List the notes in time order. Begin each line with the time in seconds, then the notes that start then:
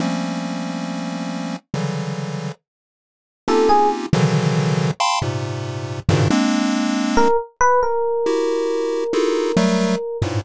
0.00 F3 G3 A3 A#3 C4 C#4
1.74 C#3 D3 E3 F#3 G3
3.48 A#3 C4 C#4 D#4 F4 G4 A4
3.69 G#4
4.13 B2 C#3 D3 D#3 E3 F#3
5.00 F5 G5 A5 B5 C6
5.22 G#2 A#2 C3
6.09 G2 G#2 A#2 B2 C#3 D#3
6.30 G#3 A#3 C4 D4
7.17 A#4
7.61 B4
7.83 A#4
8.26 E4 F#4 G4
9.13 D#4 E4 F4 F#4 G#4 A4
9.57 F#3 G3 A3
10.22 G2 G#2 A2 A#2